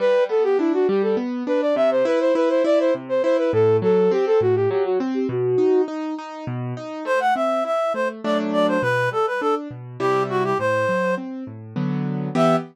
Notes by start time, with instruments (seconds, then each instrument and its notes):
0.00 acoustic grand piano G3, flute B4
0.29 acoustic grand piano B3, flute A4
0.44 flute G4
0.59 acoustic grand piano D4, flute E4
0.74 flute F#4
0.88 acoustic grand piano G3, flute G4
1.02 flute A4
1.17 acoustic grand piano B3
1.47 acoustic grand piano D4, flute B4
1.61 flute D5
1.76 acoustic grand piano C3, flute E5
1.91 flute C5
2.05 acoustic grand piano E4, flute B4
2.20 flute C5
2.35 acoustic grand piano E4, flute B4
2.49 flute C5
2.64 acoustic grand piano E4, flute D5
2.80 flute C5
2.95 acoustic grand piano C3
3.09 flute C5
3.23 acoustic grand piano E4, flute C5
3.38 flute B4
3.53 acoustic grand piano A2, flute A4
3.82 acoustic grand piano F#3, flute A4
4.11 acoustic grand piano C4, flute G4
4.26 flute A4
4.41 acoustic grand piano A2, flute F#4
4.56 flute G4
4.70 acoustic grand piano F#3, flute G4
4.85 flute F#4
5.00 acoustic grand piano C4
5.14 flute G4
5.29 acoustic grand piano B2, flute F#4
5.58 acoustic grand piano D#4
5.88 acoustic grand piano D#4
6.19 acoustic grand piano D#4
6.47 acoustic grand piano B2
6.77 acoustic grand piano D#4
7.05 acoustic grand piano A3, clarinet C5
7.20 clarinet F#5
7.35 acoustic grand piano C4, clarinet E5
7.65 acoustic grand piano E4, clarinet E5
7.94 acoustic grand piano A3, clarinet C5
8.24 acoustic grand piano F#3 A3 D4, clarinet D5
8.53 clarinet D5
8.68 clarinet C5
8.82 acoustic grand piano B2, clarinet B4
9.11 acoustic grand piano G3, clarinet A4
9.27 clarinet B4
9.41 acoustic grand piano D4, clarinet A4
9.71 acoustic grand piano B2
10.00 acoustic grand piano C3 G3 E4, clarinet G4
10.30 clarinet F#4
10.44 clarinet G4
10.59 acoustic grand piano A2, clarinet C5
10.89 acoustic grand piano F#3
11.18 acoustic grand piano C4
11.47 acoustic grand piano A2
11.76 acoustic grand piano D3 F#3 B3
12.35 acoustic grand piano E3 B3 G4, clarinet E5